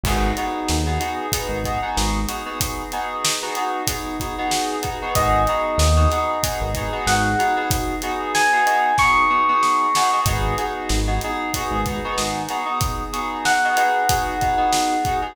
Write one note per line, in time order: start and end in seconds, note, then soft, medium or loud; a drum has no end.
0.04 0.33 G#1 loud
0.04 0.32 B3 loud
0.04 0.32 D#4 loud
0.04 0.32 F#4 loud
0.04 0.32 G#4 loud
0.04 kick loud
0.04 crash loud
0.37 0.76 B3 medium
0.37 0.76 D#4 medium
0.37 0.76 F#4 medium
0.37 0.76 G#4 medium
0.37 closed hi-hat medium
0.68 0.99 D#2 loud
0.68 snare loud
0.86 0.98 B3 medium
0.86 0.98 D#4 medium
0.86 0.98 F#4 loud
0.86 0.98 G#4 medium
1.00 1.26 B3 medium
1.00 1.26 D#4 medium
1.00 1.26 F#4 medium
1.00 1.26 G#4 medium
1.00 closed hi-hat medium
1.32 1.59 B3 loud
1.32 1.59 D#4 loud
1.32 1.59 F#4 medium
1.32 1.59 G#4 medium
1.32 kick medium
1.32 closed hi-hat loud
1.49 1.77 G#1 medium
1.64 1.79 B3 medium
1.64 1.79 D#4 medium
1.64 1.79 F#4 medium
1.64 1.79 G#4 medium
1.64 kick medium
1.64 closed hi-hat medium
1.82 2.20 B3 medium
1.82 2.20 D#4 medium
1.82 2.20 F#4 medium
1.82 2.20 G#4 medium
1.97 2.26 G#1 loud
1.97 snare loud
2.28 2.42 B3 medium
2.28 2.42 D#4 medium
2.28 2.42 F#4 medium
2.28 2.42 G#4 medium
2.28 closed hi-hat medium
2.45 2.83 B3 medium
2.45 2.83 D#4 medium
2.45 2.83 F#4 medium
2.45 2.83 G#4 medium
2.61 kick loud
2.61 closed hi-hat loud
2.92 3.32 B3 medium
2.92 3.32 D#4 medium
2.92 3.32 F#4 medium
2.92 3.32 G#4 medium
2.92 closed hi-hat medium
3.25 snare loud
3.42 3.54 B3 medium
3.42 3.54 D#4 medium
3.42 3.54 F#4 loud
3.42 3.54 G#4 medium
3.55 3.82 B3 medium
3.55 3.82 D#4 medium
3.55 3.82 F#4 medium
3.55 3.82 G#4 medium
3.55 closed hi-hat medium
3.87 4.15 B3 medium
3.87 4.15 D#4 medium
3.87 4.15 F#4 medium
3.87 4.15 G#4 medium
3.87 kick medium
3.87 closed hi-hat loud
4.20 4.34 B3 medium
4.20 4.34 D#4 medium
4.20 4.34 F#4 medium
4.20 4.34 G#4 medium
4.20 kick medium
4.20 closed hi-hat medium
4.38 4.76 B3 medium
4.38 4.76 D#4 medium
4.38 4.76 F#4 medium
4.38 4.76 G#4 medium
4.51 snare loud
4.82 4.96 B3 medium
4.82 4.96 D#4 medium
4.82 4.96 F#4 medium
4.82 4.96 G#4 medium
4.82 kick medium
4.82 closed hi-hat medium
5.02 5.13 B3 medium
5.02 5.13 D#4 medium
5.02 5.13 F#4 medium
5.02 5.13 G#4 medium
5.15 5.47 G#1 loud
5.15 5.42 B3 loud
5.15 5.42 D#4 loud
5.15 5.42 F#4 loud
5.15 5.42 G#4 loud
5.15 6.92 D#5 medium
5.15 kick loud
5.15 closed hi-hat loud
5.47 5.87 B3 medium
5.47 5.87 D#4 medium
5.47 5.87 F#4 medium
5.47 5.87 G#4 medium
5.47 closed hi-hat medium
5.78 6.07 D#2 loud
5.78 snare loud
5.97 6.08 B3 medium
5.97 6.08 D#4 medium
5.97 6.08 F#4 medium
5.97 6.08 G#4 medium
6.10 6.38 B3 medium
6.10 6.38 D#4 medium
6.10 6.38 F#4 medium
6.10 6.38 G#4 medium
6.10 snare soft
6.10 closed hi-hat medium
6.43 6.69 B3 medium
6.43 6.69 D#4 medium
6.43 6.69 F#4 medium
6.43 6.69 G#4 loud
6.43 kick loud
6.43 closed hi-hat loud
6.61 6.89 G#1 loud
6.74 6.90 B3 medium
6.74 6.90 D#4 medium
6.74 6.90 F#4 medium
6.74 6.90 G#4 loud
6.74 kick medium
6.74 closed hi-hat medium
6.92 7.30 B3 medium
6.92 7.30 D#4 medium
6.92 7.30 F#4 medium
6.92 7.30 G#4 medium
7.06 7.35 G#1 medium
7.06 7.66 F#5 soft
7.06 snare loud
7.39 7.53 B3 medium
7.39 7.53 D#4 medium
7.39 7.53 F#4 medium
7.39 7.53 G#4 loud
7.39 closed hi-hat medium
7.57 7.94 B3 medium
7.57 7.94 D#4 medium
7.57 7.94 F#4 loud
7.57 7.94 G#4 medium
7.70 kick loud
7.70 closed hi-hat loud
8.02 8.42 B3 medium
8.02 8.42 D#4 medium
8.02 8.42 F#4 medium
8.02 8.42 G#4 medium
8.02 closed hi-hat medium
8.35 8.95 G#5 medium
8.35 snare loud
8.52 8.64 B3 medium
8.52 8.64 D#4 medium
8.52 8.64 F#4 medium
8.52 8.64 G#4 loud
8.66 8.92 B3 loud
8.66 8.92 D#4 loud
8.66 8.92 F#4 medium
8.66 8.92 G#4 medium
8.66 closed hi-hat medium
8.98 9.25 B3 medium
8.98 9.25 D#4 medium
8.98 9.25 F#4 medium
8.98 9.25 G#4 medium
8.98 10.21 C#6 medium
8.98 kick medium
8.98 snare medium
9.30 9.44 B3 medium
9.30 9.44 D#4 medium
9.30 9.44 F#4 medium
9.30 9.44 G#4 medium
9.49 9.86 B3 medium
9.49 9.86 D#4 medium
9.49 9.86 F#4 medium
9.49 9.86 G#4 medium
9.63 snare medium
9.95 10.10 B3 medium
9.95 10.10 D#4 medium
9.95 10.10 F#4 medium
9.95 10.10 G#4 medium
9.95 snare loud
10.13 10.24 B3 medium
10.13 10.24 D#4 medium
10.13 10.24 F#4 medium
10.13 10.24 G#4 medium
10.25 10.54 G#1 loud
10.25 10.54 B3 loud
10.25 10.54 D#4 loud
10.25 10.54 F#4 loud
10.25 10.54 G#4 loud
10.25 kick loud
10.25 closed hi-hat loud
10.58 10.97 B3 medium
10.58 10.97 D#4 medium
10.58 10.97 F#4 loud
10.58 10.97 G#4 medium
10.58 closed hi-hat medium
10.89 11.19 G#1 medium
10.89 snare loud
11.07 11.19 B3 medium
11.07 11.19 D#4 medium
11.07 11.19 F#4 medium
11.07 11.19 G#4 medium
11.21 11.50 B3 medium
11.21 11.50 D#4 loud
11.21 11.50 F#4 medium
11.21 11.50 G#4 loud
11.21 closed hi-hat medium
11.54 11.81 B3 loud
11.54 11.81 D#4 medium
11.54 11.81 F#4 loud
11.54 11.81 G#4 loud
11.54 kick medium
11.54 closed hi-hat loud
11.71 11.99 G#1 loud
11.86 12.00 B3 medium
11.86 12.00 D#4 medium
11.86 12.00 F#4 medium
11.86 12.00 G#4 medium
11.86 kick loud
11.86 closed hi-hat medium
12.04 12.42 B3 loud
12.04 12.42 D#4 medium
12.04 12.42 F#4 loud
12.04 12.42 G#4 medium
12.18 12.47 G#1 medium
12.18 snare loud
12.49 12.64 B3 medium
12.49 12.64 D#4 medium
12.49 12.64 F#4 medium
12.49 12.64 G#4 medium
12.49 snare soft
12.49 closed hi-hat medium
12.66 13.03 B3 medium
12.66 13.03 D#4 medium
12.66 13.03 F#4 medium
12.66 13.03 G#4 medium
12.81 kick loud
12.81 closed hi-hat loud
13.13 13.52 B3 medium
13.13 13.52 D#4 medium
13.13 13.52 F#4 loud
13.13 13.52 G#4 loud
13.13 closed hi-hat medium
13.45 15.21 F#5 medium
13.45 snare loud
13.64 13.76 B3 loud
13.64 13.76 D#4 medium
13.64 13.76 F#4 medium
13.64 13.76 G#4 medium
13.77 14.03 B3 medium
13.77 14.03 D#4 medium
13.77 14.03 F#4 medium
13.77 14.03 G#4 loud
13.77 closed hi-hat medium
14.09 14.35 B3 loud
14.09 14.35 D#4 medium
14.09 14.35 F#4 loud
14.09 14.35 G#4 loud
14.09 kick loud
14.09 closed hi-hat loud
14.41 14.56 B3 medium
14.41 14.56 D#4 medium
14.41 14.56 F#4 medium
14.41 14.56 G#4 medium
14.41 kick medium
14.41 closed hi-hat medium
14.57 14.95 B3 medium
14.57 14.95 D#4 medium
14.57 14.95 F#4 medium
14.57 14.95 G#4 medium
14.73 snare loud
15.05 15.20 B3 loud
15.05 15.20 D#4 medium
15.05 15.20 F#4 medium
15.05 15.20 G#4 medium
15.05 kick loud
15.05 closed hi-hat medium
15.22 15.33 B3 medium
15.22 15.33 D#4 medium
15.22 15.33 F#4 medium
15.22 15.33 G#4 medium